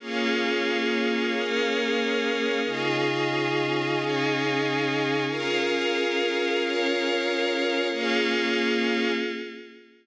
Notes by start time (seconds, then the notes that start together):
0.00 A#3 C#4 F4 G#4 C#5 F5
1.32 A#3 C#4 G#4 A#4
2.64 C#3 C#4 D#4 F4 G#4 D#5 F5
3.95 C#3 C#4 D#4 G#4
5.27 C#4 F4 G#4 A#4 F5
6.59 C#4 F4 A#4 C#5
7.91 A#3 C#4 F4 G#4 C#5 F5